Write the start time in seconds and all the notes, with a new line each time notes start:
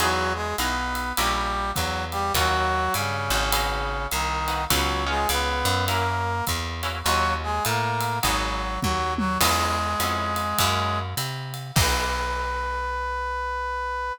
0.00 E2 F#3 D#4 E4 F#4 G#4, ride
0.34 G#3 G#4
0.58 B1 B3 D#4 E4 F#4 G#4 B4, hi-hat pedal, ride
0.95 ride
1.16 A#1 G3 C#4 E4 G4 A#4, ride
1.74 E2 F#3 F#4, kick, hi-hat pedal, ride
2.11 G3 G4, ride
2.34 D#2 F#3 C#4 D#4 F4 F#4, kick, ride
2.94 G2 C#3 C#4, hi-hat pedal, ride
3.30 G#1 C#4 D#4 F4 F#4, ride
3.52 B3 D#4 F#4 G#4, ride
4.11 C2 D#3 D#4, hi-hat pedal, ride
4.48 B3 D#4 F#4 G#4, ride
4.70 C#2 F#3 B3 C#4 F#4 G#4, kick, ride
5.06 G#3 B3 C#4 D#4 F4 G#4
5.29 C#2 B3 B4, hi-hat pedal, ride
5.65 F#2, ride
5.88 A#3 C#4 E4 F#4 A#4, ride
6.47 E2, kick, hi-hat pedal, ride
6.83 A#3 C#4 E4 F#4, ride
7.03 D#2 F#3 C#4 D#4 F4 F#4, ride
7.43 G#3 G#4
7.65 A2 A#3 A#4, hi-hat pedal, ride
8.01 ride
8.23 G#1 F#3 B3 D#4 F#4 G#4, kick, ride
8.81 D#2 F#3 F#4, kick, high tom
9.18 F#3 F#4, high tom
9.39 E2 G#3 B3 C#4 E4 G#4, kick, crash, ride
10.00 F2 B3 C#4 E4 G#4, hi-hat pedal, ride
10.36 ride
10.58 F#2 A#3 C#4 E4 F#4, kick, ride
11.17 C3, hi-hat pedal, ride
11.54 ride
11.76 B1 A#3 B3 D#4 F#4 B4, kick, crash